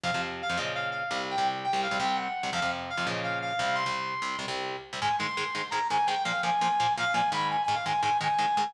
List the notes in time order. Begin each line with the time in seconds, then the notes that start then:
0.03 F2 C3 F3 F5
0.14 F2 C3 F3
0.42 F5
0.49 F2 C3 F3
0.57 A#2 C#3 F3 D#5
0.75 F5
0.91 F5
1.11 C2 C3 G3
1.31 G5
1.38 C2 C3 G3
1.64 G5
1.73 C2 C3 G3
1.83 F5
1.91 C2 C3 G3
2.00 C2 C3 G3 G5
2.16 F#5
2.43 C2 C3 G3
2.53 F2 C3 F3 F5
2.62 F2 C3 F3
2.90 F5
2.97 F2 C3 F3
3.06 A#2 C#3 F3 D#5
3.23 F5
3.42 F5
3.59 C2 C3 G3
3.75 C6
3.86 C2 C3 G3
4.22 C2 C3 G3
4.39 C2 C3 G3
4.48 C2 C3 G3
4.93 C2 C3 G3
5.01 G#2 D#3 G#3 G#5
5.19 G#2 D#3 G#3 C6
5.37 G#2 D#3 G#3
5.55 G#2 D#3 G#3
5.71 G#2 D#3 G#3 A#5
5.90 G#2 D#3 G#3 G#5
6.07 G#2 D#3 G#3 G5
6.24 A#2 F3 A#3 F5
6.43 A#2 F3 A#3 G#5
6.61 A#2 F3 A#3
6.80 A#2 F3 A#3
6.97 A#2 F3 A#3 F5
7.14 A#2 F3 A#3 G#5
7.32 G#2 D#3 G#3 B5
7.51 G#5
7.64 G#5
7.68 G#2 D#3 G#3
7.74 F5
7.86 G#2 D#3 G#3 G#5
8.02 G#2 D#3 G#3 G#5
8.21 G#2 D#3 G#3 G#5
8.39 G#2 D#3 G#3
8.57 G#2 D#3 G#3